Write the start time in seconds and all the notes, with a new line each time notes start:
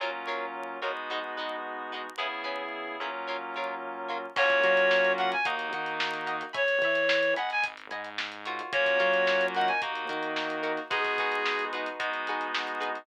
0.00 F#3 A#3 C#4 F4 A#4 C#5
0.27 F#3 F4 A#4 C#5
0.82 F#3 G#3 B3 D#4 F4 F#4 A#4 C#5
1.10 G#3 D#4 F#4 B4
1.37 G#3 D#4 F#4 B4
1.92 G#3 D#4 F#4 B4
2.18 C#3 B3 C#4 E4 G#4 B4
2.44 C#4 E4 G#4 B4
3.00 F#3 A#3 C#4 E4 F4 G#4 B4
3.28 F#3 F4 A#4 C#5
3.56 F#3 F4 A#4 C#5
4.09 F#3 F4 A#4 C#5
4.36 F#2 A#3 C#4 F4 F#4 C#5 F5 F#5 A#5 C#6, kick, crash
4.50 kick, closed hi-hat
4.64 F#3 F5 F#5 A#5 C#6, kick, closed hi-hat
4.77 snare, closed hi-hat
4.91 snare
5.05 closed hi-hat
5.18 F5 F#5 A#5 C#6, snare, closed hi-hat
5.32 G#5, snare, closed hi-hat
5.45 D#2 A#3 D#4 F#4 D#5 F#5 A#5, kick, closed hi-hat
5.59 closed hi-hat
5.73 D#3 D#5 F#5 A#5, closed hi-hat
5.86 closed hi-hat
6.00 snare
6.14 snare, closed hi-hat
6.27 D#5 F#5 A#5, snare, closed hi-hat
6.41 closed hi-hat
6.53 E2 C#5 E5 G#5 B5, kick, closed hi-hat
6.68 closed hi-hat
6.82 E3 C#5 E5 G#5 B5, kick, closed hi-hat
6.95 closed hi-hat
7.09 snare
7.23 closed hi-hat
7.36 G#1 D#5 F#5 G#5 B5, snare, closed hi-hat
7.50 G#5, closed hi-hat
7.64 kick, closed hi-hat
7.77 closed hi-hat
7.90 G#2 D#5 F#5 G#5 B5, closed hi-hat
8.05 closed hi-hat
8.18 snare
8.32 closed hi-hat
8.46 F4 F#4 A#4 C#5, closed hi-hat
8.59 closed hi-hat
8.73 F#2 A#3 C#4 F4 F#4 C#5, kick, closed hi-hat
8.86 kick, snare, closed hi-hat
8.99 F#3 F4 F#4 A#4 C#5, snare, closed hi-hat
9.14 closed hi-hat
9.27 snare
9.41 closed hi-hat
9.55 D#4 F#4 A#4 F#5, closed hi-hat
9.68 G#5, closed hi-hat
9.82 D#2 A#3 D#4 F#4, kick, closed hi-hat
9.95 closed hi-hat
10.09 D#3 D#4 F#4 A#4, closed hi-hat
10.23 closed hi-hat
10.36 snare
10.50 closed hi-hat
10.63 D#4 F#4 A#4, closed hi-hat
10.77 snare, closed hi-hat
10.90 G#3 B3 D#4 F#4 G#4 B4, kick, closed hi-hat
11.05 kick, snare, closed hi-hat
11.18 D#4 F#4 G#4 B4, kick, closed hi-hat
11.32 closed hi-hat
11.46 snare
11.59 closed hi-hat
11.73 D#4 F#4 G#4 B4, closed hi-hat
11.86 closed hi-hat
12.00 G#3 B3 D#4 F#4, kick, closed hi-hat
12.14 closed hi-hat
12.27 D#4 F#4 G#4 B4, closed hi-hat
12.41 closed hi-hat
12.54 snare
12.68 closed hi-hat
12.80 D#4 F#4 G#4 B4, closed hi-hat
12.95 closed hi-hat